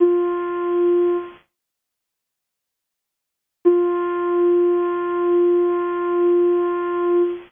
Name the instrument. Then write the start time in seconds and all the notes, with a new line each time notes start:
ocarina
0.00 F4
3.65 F4